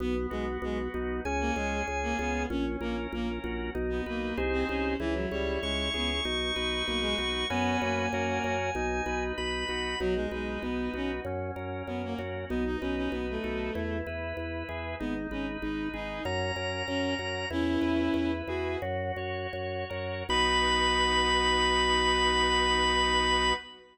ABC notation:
X:1
M:4/4
L:1/16
Q:1/4=96
K:B
V:1 name="Drawbar Organ"
z8 g8 | z16 | z4 c'12 | g12 b4 |
z16 | z16 | z8 a8 | "^rit." z16 |
b16 |]
V:2 name="Violin"
B, z G, z G, z4 A, G,2 z A, B,2 | C z A, z A, z4 B, A,2 z ^B, C2 | E, F, =G,2 ^G,2 B, z5 A, G, z2 | B,2 A,6 z8 |
F, G, G,2 B,2 C z5 B, A, z2 | B, D C C B, =A,5 z6 | B, z C z D2 D2 z4 C2 z2 | "^rit." [CE]6 F2 z8 |
B16 |]
V:3 name="Drawbar Organ"
B,2 F2 B,2 D2 C2 G2 C2 ^E2 | C2 A2 C2 F2 D2 B2 [DG^B]4 | E2 c2 E2 G2 D2 B2 D2 F2 | [CFB]4 [CFA]4 D2 B2 D2 F2 |
D2 B2 D2 F2 C2 A2 C2 F2 | D2 B2 D2 =A2 E2 B2 E2 G2 | D2 B2 D2 G2 C2 A2 C2 F2 | "^rit." E2 B2 E2 G2 F2 c2 F2 A2 |
[B,DF]16 |]
V:4 name="Drawbar Organ" clef=bass
B,,,2 B,,,2 B,,,2 B,,,2 C,,2 C,,2 C,,2 C,,2 | A,,,2 A,,,2 A,,,2 A,,,2 B,,,2 B,,,2 ^B,,,2 B,,,2 | C,,2 C,,2 C,,2 C,,2 B,,,2 B,,,2 B,,,2 B,,,2 | F,,2 F,,2 F,,2 F,,2 B,,,2 B,,,2 B,,,2 B,,,2 |
B,,,2 B,,,2 B,,,2 B,,,2 F,,2 F,,2 F,,2 F,,2 | B,,,2 B,,,2 B,,,2 B,,,2 E,,2 E,,2 E,,2 E,,2 | G,,,2 G,,,2 G,,,2 G,,,2 F,,2 F,,2 F,,2 F,,2 | "^rit." E,,2 E,,2 E,,2 E,,2 F,,2 F,,2 F,,2 F,,2 |
B,,,16 |]